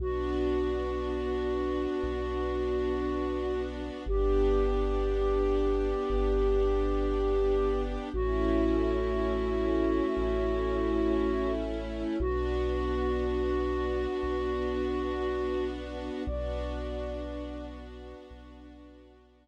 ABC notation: X:1
M:4/4
L:1/8
Q:1/4=59
K:Bm
V:1 name="Flute"
F8 | G8 | F8 | F8 |
d3 z5 |]
V:2 name="Synth Bass 2" clef=bass
B,,,4 B,,,4 | G,,,4 G,,,4 | A,,,4 A,,,4 | B,,,4 B,,,4 |
B,,,4 B,,,4 |]
V:3 name="String Ensemble 1"
[B,DF]8 | [B,DG]8 | [A,CE]8 | [B,DF]8 |
[B,DF]8 |]